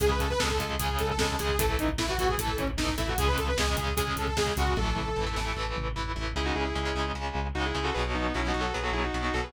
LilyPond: <<
  \new Staff \with { instrumentName = "Lead 2 (sawtooth)" } { \time 4/4 \key cis \minor \tempo 4 = 151 gis'16 b'16 a'16 b'16 a'4 gis'8 a'16 a'16 a'8 gis'8 | a'8 dis'16 r16 e'16 fis'16 fis'16 gis'16 a'8 cis'16 r16 dis'8 e'16 fis'16 | gis'16 b'16 a'16 b'16 gis'4 gis'8 a'16 a'16 gis'8 fis'8 | a'2~ a'8 r4. |
r1 | r1 | }
  \new Staff \with { instrumentName = "Distortion Guitar" } { \time 4/4 \key cis \minor r1 | r1 | r1 | r1 |
<e' gis'>16 <dis' fis'>16 <e' gis'>16 <e' gis'>4~ <e' gis'>16 r4 <dis' fis'>16 <e' gis'>8 <fis' a'>16 | <gis' b'>16 r16 <b dis'>8 \tuplet 3/2 { <cis' e'>8 <dis' fis'>8 <fis' a'>8 } <gis' b'>16 <fis' a'>16 <e' gis'>16 <dis' fis'>8 <dis' fis'>16 <fis' a'>16 <gis' b'>16 | }
  \new Staff \with { instrumentName = "Overdriven Guitar" } { \time 4/4 \key cis \minor <cis gis>4 <cis gis>16 <cis gis>16 <cis gis>8 <cis gis>4 <cis gis>8 <cis gis>8 | <e a>4 <e a>16 <e a>16 <e a>8 <e a>4 <e a>8 <e a>8 | <cis gis>4 <cis gis>16 <cis gis>16 <cis gis>8 <cis gis>4 <cis gis>8 <cis gis>8 | <e a>4 <e a>16 <e a>16 <e a>8 <e a>4 <e a>8 <e a>8 |
<cis gis>4 <cis gis>16 <cis gis>16 <cis gis>8 <cis gis>4 <cis gis>8 <cis gis>8 | <b, fis>4 <b, fis>16 <b, fis>16 <b, fis>8 <b, fis>4 <b, fis>8 <b, fis>8 | }
  \new Staff \with { instrumentName = "Synth Bass 1" } { \clef bass \time 4/4 \key cis \minor cis,8 cis,8 cis,8 cis,8 cis,8 cis,8 cis,8 cis,8 | a,,8 a,,8 a,,8 a,,8 a,,8 a,,8 a,,8 a,,8 | cis,8 cis,8 cis,8 cis,8 cis,8 cis,8 cis,8 cis,8 | a,,8 a,,8 a,,8 a,,8 a,,8 a,,8 a,,8 a,,8 |
cis,8 cis,8 cis,8 cis,8 cis,8 cis,8 cis,8 cis,8 | b,,8 b,,8 b,,8 b,,8 b,,8 b,,8 b,,8 b,,8 | }
  \new DrumStaff \with { instrumentName = "Drums" } \drummode { \time 4/4 <hh bd>16 bd16 <hh bd>16 bd16 <bd sn>16 bd16 <hh bd>16 bd16 <hh bd>16 bd16 <hh bd>16 bd16 <bd sn>16 bd16 <hh bd sn>16 bd16 | <hh bd>16 bd16 <hh bd>16 bd16 <bd sn>16 bd16 <hh bd>16 bd16 <hh bd>16 bd16 <hh bd>16 bd16 <bd sn>16 bd16 <hh bd sn>16 bd16 | <hh bd>16 bd16 <hh bd>16 bd16 <bd sn>16 bd16 <hh bd>16 bd16 <hh bd>16 bd16 <hh bd>16 bd16 <bd sn>16 bd16 <hh bd sn>16 bd16 | <bd tommh>8 toml8 tomfh8 sn8 r8 toml8 tomfh4 |
r4 r4 r4 r4 | r4 r4 r4 r4 | }
>>